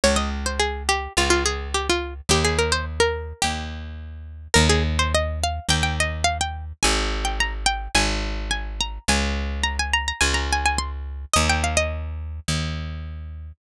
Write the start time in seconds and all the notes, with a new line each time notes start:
0.04 C#2 C#5
0.16 D#5
0.46 C5
0.60 G#4
0.89 G4
1.17 C#2 F4
1.30 F4
1.46 G#4
1.74 G4
1.90 F4
2.29 D#2 G4
2.45 G#4
2.59 A#4
2.72 C5
3.00 A#4
3.42 D#2 G4
4.54 D#2 A#4
4.69 G#4
4.99 C5
5.15 D#5
5.44 F5
5.69 D#2 G5
5.83 G5
6.00 D#5
6.24 F5
6.41 G5
6.83 G#1 G#5
7.25 G5
7.40 A#5
7.66 G5
7.95 G#1 G#5
8.51 G#5
8.81 A#5
9.08 C#2 G#5
9.64 A#5
9.79 G#5
9.94 A#5
10.08 A#5
10.21 C#2 G#5
10.34 A#5
10.53 G#5
10.66 G#5
10.78 C6
11.33 D#2 D#5
11.50 G5
11.64 F5
11.77 D#5
12.48 D#2